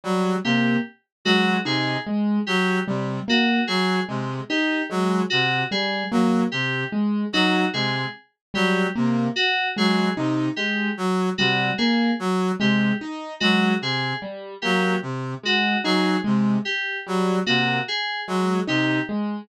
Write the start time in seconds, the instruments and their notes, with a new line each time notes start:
0.04 brass section F#3, acoustic grand piano G3
0.44 brass section C3, acoustic grand piano A#3, electric piano 2 G4
1.25 brass section F#3, acoustic grand piano G#3, electric piano 2 F#4
1.65 brass section C3, acoustic grand piano D#4, electric piano 2 G#4
2.07 acoustic grand piano G#3
2.47 brass section F#3, electric piano 2 G4
2.87 brass section C3, acoustic grand piano G3
3.28 acoustic grand piano A#3, electric piano 2 F#4
3.67 brass section F#3, electric piano 2 G#4
4.08 brass section C3, acoustic grand piano G#3
4.50 acoustic grand piano D#4, electric piano 2 G4
4.90 brass section F#3, acoustic grand piano G#3
5.30 brass section C3, electric piano 2 F#4
5.71 acoustic grand piano G3, electric piano 2 G#4
6.11 brass section F#3, acoustic grand piano A#3
6.52 brass section C3, electric piano 2 G4
6.92 acoustic grand piano G#3
7.33 brass section F#3, acoustic grand piano D#4, electric piano 2 F#4
7.73 brass section C3, acoustic grand piano G#3, electric piano 2 G#4
8.54 brass section F#3, acoustic grand piano G3, electric piano 2 G4
8.96 brass section C3, acoustic grand piano A#3
9.36 electric piano 2 F#4
9.77 brass section F#3, acoustic grand piano G#3, electric piano 2 G#4
10.17 brass section C3, acoustic grand piano D#4
10.56 acoustic grand piano G#3, electric piano 2 G4
10.97 brass section F#3
11.38 brass section C3, acoustic grand piano G3, electric piano 2 F#4
11.78 acoustic grand piano A#3, electric piano 2 G#4
12.20 brass section F#3
12.60 brass section C3, acoustic grand piano G#3, electric piano 2 G4
13.01 acoustic grand piano D#4
13.40 brass section F#3, acoustic grand piano G#3, electric piano 2 F#4
13.81 brass section C3, electric piano 2 G#4
14.22 acoustic grand piano G3
14.62 brass section F#3, acoustic grand piano A#3, electric piano 2 G4
15.02 brass section C3
15.43 acoustic grand piano G#3, electric piano 2 F#4
15.84 brass section F#3, acoustic grand piano D#4, electric piano 2 G#4
16.24 brass section C3, acoustic grand piano G#3
16.65 electric piano 2 G4
17.07 brass section F#3, acoustic grand piano G3
17.46 brass section C3, acoustic grand piano A#3, electric piano 2 F#4
17.88 electric piano 2 G#4
18.28 brass section F#3, acoustic grand piano G#3
18.67 brass section C3, acoustic grand piano D#4, electric piano 2 G4
19.09 acoustic grand piano G#3